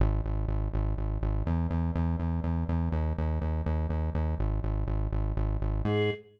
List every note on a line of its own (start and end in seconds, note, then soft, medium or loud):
0.00 0.21 G#1 loud
0.25 0.46 G#1 medium
0.48 0.69 G#1 medium
0.73 0.94 G#1 loud
0.97 1.18 G#1 medium
1.22 1.43 G#1 loud
1.47 1.67 E2 loud
1.71 1.91 E2 loud
1.95 2.16 E2 loud
2.19 2.40 E2 medium
2.44 2.64 E2 medium
2.69 2.89 E2 loud
2.92 3.13 D#2 loud
3.18 3.39 D#2 loud
3.41 3.62 D#2 medium
3.66 3.87 D#2 loud
3.89 4.10 D#2 medium
4.14 4.35 D#2 medium
4.39 4.60 G#1 loud
4.64 4.85 G#1 medium
4.87 5.08 G#1 medium
5.12 5.33 G#1 medium
5.37 5.58 G#1 loud
5.61 5.82 G#1 loud
5.85 6.11 G#2 loud
5.85 6.10 G#4 loud